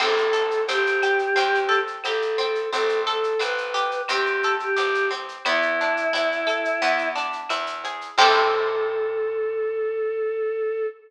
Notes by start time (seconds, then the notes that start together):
0.00 A1 C4 A4, crash, cowbell, claves
0.17 shaker
0.33 A4, shaker
0.51 shaker
0.68 A1 C4 G4, cowbell, shaker
0.87 shaker
1.02 G4, claves, shaker
1.19 shaker
1.36 E2 C4, cowbell, shaker
1.55 shaker
1.69 A4, shaker
1.87 shaker
2.04 A1 G4 A4, cowbell, claves, shaker
2.22 shaker
2.38 C4, cowbell, shaker
2.55 shaker
2.73 A1 C4 A4, cowbell, shaker
2.89 shaker
3.07 A4, shaker
3.23 shaker
3.39 A1 C4 B4, cowbell, claves, shaker
3.58 shaker
3.74 G4, shaker
3.91 shaker
4.08 E2 C4 G4, cowbell, claves, shaker
4.26 shaker
4.43 A4, shaker
4.60 G4, shaker
4.76 A1 G4, cowbell, shaker
4.94 shaker
5.11 C4, cowbell, shaker
5.29 shaker
5.45 E2 B3 E4, cowbell, claves, shaker
5.62 shaker
5.81 D4, shaker
5.97 shaker
6.13 E2 E4, cowbell, shaker
6.32 shaker
6.47 A4, claves, shaker
6.65 shaker
6.82 E2 B3, cowbell, shaker
6.98 shaker
7.15 D4, shaker
7.33 shaker
7.49 E2 E4, cowbell, claves, shaker
7.66 shaker
7.84 G#4, cowbell, shaker
8.01 shaker
8.18 A2 C4 E4 G4 A4, kick, crash